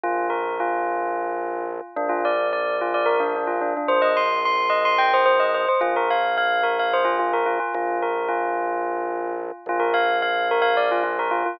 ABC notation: X:1
M:7/8
L:1/16
Q:1/4=109
K:Bb
V:1 name="Tubular Bells"
F2 B2 F8 z2 | D F d2 d2 F d B D D F D D | c e c'2 c'2 e c' g c c e c c | F B f2 f2 B f c F F B F F |
F2 B2 F8 z2 | F B f2 f2 B f d F F B F F |]
V:2 name="Drawbar Organ" clef=bass
B,,,14 | B,,,14 | B,,,14 | B,,,14 |
B,,,14 | B,,,14 |]